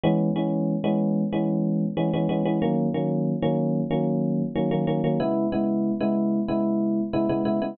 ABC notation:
X:1
M:4/4
L:1/16
Q:1/4=93
K:C#dor
V:1 name="Electric Piano 1"
[E,G,B,C]2 [E,G,B,C]3 [E,G,B,C]3 [E,G,B,C]4 [E,G,B,C] [E,G,B,C] [E,G,B,C] [E,G,B,C] | [D,F,A,C]2 [D,F,A,C]3 [D,F,A,C]3 [D,F,A,C]4 [D,F,A,C] [D,F,A,C] [D,F,A,C] [D,F,A,C] | [C,G,B,E]2 [C,G,B,E]3 [C,G,B,E]3 [C,G,B,E]4 [C,G,B,E] [C,G,B,E] [C,G,B,E] [C,G,B,E] |]